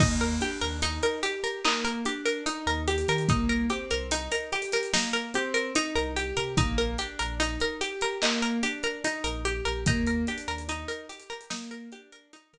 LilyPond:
<<
  \new Staff \with { instrumentName = "Pizzicato Strings" } { \time 4/4 \key ees \major \tempo 4 = 73 ees'16 bes'16 g'16 bes'16 ees'16 bes'16 g'16 bes'16 ees'16 bes'16 g'16 bes'16 ees'16 bes'16 g'16 bes'16 | ees'16 bes'16 g'16 bes'16 ees'16 bes'16 g'16 bes'16 ees'16 bes'16 g'16 bes'16 ees'16 bes'16 g'16 bes'16 | ees'16 bes'16 g'16 bes'16 ees'16 bes'16 g'16 bes'16 ees'16 bes'16 g'16 bes'16 ees'16 bes'16 g'16 bes'16 | ees'16 bes'16 g'16 bes'16 ees'16 bes'16 g'16 bes'16 ees'16 bes'16 g'16 bes'16 ees'16 bes'16 r8 | }
  \new Staff \with { instrumentName = "Acoustic Grand Piano" } { \time 4/4 \key ees \major bes8 d'8 ees'8 g'8 bes8 d'8 ees'8 g'8 | bes8 c'8 ees'8 g'8 bes8 c'8 ees'8 g'8 | bes8 d'8 ees'8 g'8 bes8 d'8 ees'8 g'8 | bes8 d'8 ees'8 g'8 bes8 d'8 ees'8 r8 | }
  \new Staff \with { instrumentName = "Synth Bass 2" } { \clef bass \time 4/4 \key ees \major ees,8. ees,2~ ees,8 ees,8 ees16 | c,8. c,2~ c,8 c,8 c16 | bes,,8. bes,,2~ bes,,8 bes,,8 bes,,16 | ees,8. ees,2~ ees,8 ees8 r16 | }
  \new DrumStaff \with { instrumentName = "Drums" } \drummode { \time 4/4 <cymc bd>16 hh16 hh16 hh16 hh16 hh16 hh16 hh16 hc16 hh16 hh16 hh16 hh16 hh16 hh32 hh32 hh32 hh32 | <hh bd>16 hh16 hh16 hh16 hh16 hh16 hh32 hh32 <hh sn>32 hh32 sn16 hh16 hh16 hh16 hh16 hh16 hh16 hh16 | <hh bd>16 hh16 hh16 hh16 hh16 hh16 hh16 hh16 hc16 hh16 hh16 hh16 hh16 hh16 hh16 hh16 | <hh bd>16 hh16 hh32 hh32 hh32 hh32 hh16 hh16 hh32 hh32 hh32 hh32 sn16 hh16 hh16 hh16 hh16 hh8. | }
>>